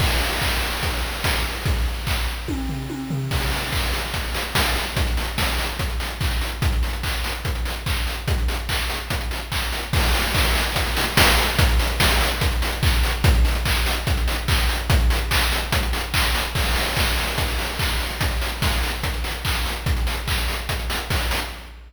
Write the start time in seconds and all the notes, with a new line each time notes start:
0.00 kick, crash
0.41 kick, clap
0.62 snare
0.83 kick, closed hi-hat
1.24 kick, snare
1.66 kick, closed hi-hat
2.07 kick, clap
2.27 snare
2.48 kick, high tom
2.69 floor tom
2.90 high tom
3.10 floor tom
3.31 kick, crash
3.41 closed hi-hat
3.52 open hi-hat
3.62 closed hi-hat
3.72 kick, clap
3.83 closed hi-hat
3.93 snare, open hi-hat
4.03 closed hi-hat
4.14 kick, closed hi-hat
4.24 closed hi-hat
4.34 open hi-hat
4.45 closed hi-hat
4.55 kick, snare
4.65 closed hi-hat
4.76 open hi-hat
4.86 closed hi-hat
4.96 kick, closed hi-hat
5.07 closed hi-hat
5.17 open hi-hat
5.28 closed hi-hat
5.38 kick, snare
5.48 closed hi-hat
5.59 snare, open hi-hat
5.69 closed hi-hat
5.79 kick, closed hi-hat
5.90 closed hi-hat
6.00 open hi-hat
6.10 closed hi-hat
6.21 kick, clap
6.31 closed hi-hat
6.41 open hi-hat
6.52 closed hi-hat
6.62 kick, closed hi-hat
6.72 closed hi-hat
6.83 open hi-hat
6.93 closed hi-hat
7.03 kick, clap
7.14 closed hi-hat
7.24 snare, open hi-hat
7.34 closed hi-hat
7.45 kick, closed hi-hat
7.55 closed hi-hat
7.65 open hi-hat
7.76 closed hi-hat
7.86 kick, clap
7.97 closed hi-hat
8.07 open hi-hat
8.17 closed hi-hat
8.28 kick, closed hi-hat
8.38 closed hi-hat
8.48 open hi-hat
8.59 closed hi-hat
8.69 kick, clap
8.79 closed hi-hat
8.90 snare, open hi-hat
9.00 closed hi-hat
9.10 kick, closed hi-hat
9.21 closed hi-hat
9.31 open hi-hat
9.41 closed hi-hat
9.52 kick, clap
9.62 closed hi-hat
9.72 open hi-hat
9.83 closed hi-hat
9.93 kick, crash
10.03 closed hi-hat
10.14 open hi-hat
10.24 closed hi-hat
10.34 kick, clap
10.45 closed hi-hat
10.55 snare, open hi-hat
10.65 closed hi-hat
10.76 kick, closed hi-hat
10.86 closed hi-hat
10.97 open hi-hat
11.07 closed hi-hat
11.17 kick, snare
11.28 closed hi-hat
11.38 open hi-hat
11.48 closed hi-hat
11.59 kick, closed hi-hat
11.69 closed hi-hat
11.79 open hi-hat
11.90 closed hi-hat
12.00 kick, snare
12.10 closed hi-hat
12.21 snare, open hi-hat
12.31 closed hi-hat
12.41 kick, closed hi-hat
12.52 closed hi-hat
12.62 open hi-hat
12.72 closed hi-hat
12.83 kick, clap
12.93 closed hi-hat
13.03 open hi-hat
13.14 closed hi-hat
13.24 kick, closed hi-hat
13.34 closed hi-hat
13.45 open hi-hat
13.55 closed hi-hat
13.65 kick, clap
13.76 closed hi-hat
13.86 snare, open hi-hat
13.97 closed hi-hat
14.07 kick, closed hi-hat
14.17 closed hi-hat
14.28 open hi-hat
14.38 closed hi-hat
14.48 kick, clap
14.59 closed hi-hat
14.69 open hi-hat
14.79 closed hi-hat
14.90 kick, closed hi-hat
15.00 closed hi-hat
15.10 open hi-hat
15.21 closed hi-hat
15.31 kick, clap
15.41 closed hi-hat
15.52 snare, open hi-hat
15.62 closed hi-hat
15.72 kick, closed hi-hat
15.83 closed hi-hat
15.93 open hi-hat
16.03 closed hi-hat
16.14 kick, clap
16.24 closed hi-hat
16.34 open hi-hat
16.45 closed hi-hat
16.55 kick, crash
16.66 closed hi-hat
16.76 open hi-hat
16.86 closed hi-hat
16.97 kick, clap
17.07 closed hi-hat
17.17 open hi-hat
17.28 closed hi-hat
17.38 kick, closed hi-hat
17.48 closed hi-hat
17.59 open hi-hat
17.69 closed hi-hat
17.79 kick, clap
17.90 closed hi-hat
18.00 open hi-hat
18.10 closed hi-hat
18.21 kick, closed hi-hat
18.31 closed hi-hat
18.41 open hi-hat
18.52 closed hi-hat
18.62 kick, snare
18.72 closed hi-hat
18.83 open hi-hat
18.93 closed hi-hat
19.03 kick, closed hi-hat
19.14 closed hi-hat
19.24 open hi-hat
19.34 closed hi-hat
19.45 kick, clap
19.55 closed hi-hat
19.65 open hi-hat
19.76 closed hi-hat
19.86 kick, closed hi-hat
19.97 closed hi-hat
20.07 open hi-hat
20.17 closed hi-hat
20.28 kick, clap
20.38 closed hi-hat
20.48 open hi-hat
20.59 closed hi-hat
20.69 kick, closed hi-hat
20.79 closed hi-hat
20.90 open hi-hat
21.00 closed hi-hat
21.10 kick, snare
21.21 closed hi-hat
21.31 open hi-hat
21.41 closed hi-hat